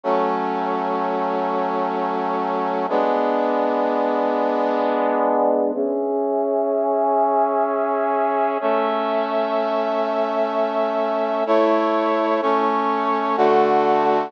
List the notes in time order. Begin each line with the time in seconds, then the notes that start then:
0.03 F#3 A3 C#4
2.89 G#3 B3 D4
5.75 C#4 G#4 E5
8.61 A3 C#4 E5
11.46 A3 E4 C#5
12.42 A3 C#4 C#5
13.37 D3 A3 F#4